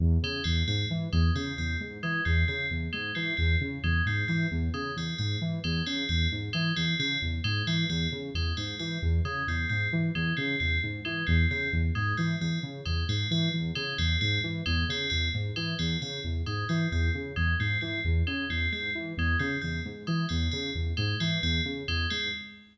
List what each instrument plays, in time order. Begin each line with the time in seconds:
0.00 lead 2 (sawtooth) E2
0.23 lead 2 (sawtooth) C#3, tubular bells G#3
0.44 lead 2 (sawtooth) E2, tubular bells C4
0.67 lead 2 (sawtooth) G#2, tubular bells C4
0.90 lead 2 (sawtooth) E3
1.13 lead 2 (sawtooth) E2, tubular bells G#3
1.35 lead 2 (sawtooth) C#3, tubular bells C4
1.58 lead 2 (sawtooth) E2, tubular bells C4
1.80 lead 2 (sawtooth) G#2
2.03 lead 2 (sawtooth) E3, tubular bells G#3
2.25 lead 2 (sawtooth) E2, tubular bells C4
2.48 lead 2 (sawtooth) C#3, tubular bells C4
2.71 lead 2 (sawtooth) E2
2.93 lead 2 (sawtooth) G#2, tubular bells G#3
3.15 lead 2 (sawtooth) E3, tubular bells C4
3.37 lead 2 (sawtooth) E2, tubular bells C4
3.61 lead 2 (sawtooth) C#3
3.83 lead 2 (sawtooth) E2, tubular bells G#3
4.06 lead 2 (sawtooth) G#2, tubular bells C4
4.28 lead 2 (sawtooth) E3, tubular bells C4
4.51 lead 2 (sawtooth) E2
4.74 lead 2 (sawtooth) C#3, tubular bells G#3
4.96 lead 2 (sawtooth) E2, tubular bells C4
5.18 lead 2 (sawtooth) G#2, tubular bells C4
5.41 lead 2 (sawtooth) E3
5.64 lead 2 (sawtooth) E2, tubular bells G#3
5.86 lead 2 (sawtooth) C#3, tubular bells C4
6.09 lead 2 (sawtooth) E2, tubular bells C4
6.32 lead 2 (sawtooth) G#2
6.53 lead 2 (sawtooth) E3, tubular bells G#3
6.76 lead 2 (sawtooth) E2, tubular bells C4
6.99 lead 2 (sawtooth) C#3, tubular bells C4
7.22 lead 2 (sawtooth) E2
7.44 lead 2 (sawtooth) G#2, tubular bells G#3
7.67 lead 2 (sawtooth) E3, tubular bells C4
7.89 lead 2 (sawtooth) E2, tubular bells C4
8.12 lead 2 (sawtooth) C#3
8.34 lead 2 (sawtooth) E2, tubular bells G#3
8.57 lead 2 (sawtooth) G#2, tubular bells C4
8.79 lead 2 (sawtooth) E3, tubular bells C4
9.02 lead 2 (sawtooth) E2
9.25 lead 2 (sawtooth) C#3, tubular bells G#3
9.47 lead 2 (sawtooth) E2, tubular bells C4
9.69 lead 2 (sawtooth) G#2, tubular bells C4
9.93 lead 2 (sawtooth) E3
10.15 lead 2 (sawtooth) E2, tubular bells G#3
10.37 lead 2 (sawtooth) C#3, tubular bells C4
10.60 lead 2 (sawtooth) E2, tubular bells C4
10.83 lead 2 (sawtooth) G#2
11.05 lead 2 (sawtooth) E3, tubular bells G#3
11.27 lead 2 (sawtooth) E2, tubular bells C4
11.50 lead 2 (sawtooth) C#3, tubular bells C4
11.73 lead 2 (sawtooth) E2
11.95 lead 2 (sawtooth) G#2, tubular bells G#3
12.17 lead 2 (sawtooth) E3, tubular bells C4
12.41 lead 2 (sawtooth) E2, tubular bells C4
12.63 lead 2 (sawtooth) C#3
12.85 lead 2 (sawtooth) E2, tubular bells G#3
13.08 lead 2 (sawtooth) G#2, tubular bells C4
13.31 lead 2 (sawtooth) E3, tubular bells C4
13.53 lead 2 (sawtooth) E2
13.75 lead 2 (sawtooth) C#3, tubular bells G#3
13.98 lead 2 (sawtooth) E2, tubular bells C4
14.21 lead 2 (sawtooth) G#2, tubular bells C4
14.44 lead 2 (sawtooth) E3
14.66 lead 2 (sawtooth) E2, tubular bells G#3
14.89 lead 2 (sawtooth) C#3, tubular bells C4
15.10 lead 2 (sawtooth) E2, tubular bells C4
15.34 lead 2 (sawtooth) G#2
15.56 lead 2 (sawtooth) E3, tubular bells G#3
15.79 lead 2 (sawtooth) E2, tubular bells C4
16.02 lead 2 (sawtooth) C#3, tubular bells C4
16.24 lead 2 (sawtooth) E2
16.46 lead 2 (sawtooth) G#2, tubular bells G#3
16.69 lead 2 (sawtooth) E3, tubular bells C4
16.92 lead 2 (sawtooth) E2, tubular bells C4
17.14 lead 2 (sawtooth) C#3
17.36 lead 2 (sawtooth) E2, tubular bells G#3
17.60 lead 2 (sawtooth) G#2, tubular bells C4
17.81 lead 2 (sawtooth) E3, tubular bells C4
18.05 lead 2 (sawtooth) E2
18.27 lead 2 (sawtooth) C#3, tubular bells G#3
18.50 lead 2 (sawtooth) E2, tubular bells C4
18.72 lead 2 (sawtooth) G#2, tubular bells C4
18.95 lead 2 (sawtooth) E3
19.17 lead 2 (sawtooth) E2, tubular bells G#3
19.39 lead 2 (sawtooth) C#3, tubular bells C4
19.61 lead 2 (sawtooth) E2, tubular bells C4
19.85 lead 2 (sawtooth) G#2
20.07 lead 2 (sawtooth) E3, tubular bells G#3
20.29 lead 2 (sawtooth) E2, tubular bells C4
20.52 lead 2 (sawtooth) C#3, tubular bells C4
20.75 lead 2 (sawtooth) E2
20.97 lead 2 (sawtooth) G#2, tubular bells G#3
21.20 lead 2 (sawtooth) E3, tubular bells C4
21.43 lead 2 (sawtooth) E2, tubular bells C4
21.65 lead 2 (sawtooth) C#3
21.88 lead 2 (sawtooth) E2, tubular bells G#3
22.10 lead 2 (sawtooth) G#2, tubular bells C4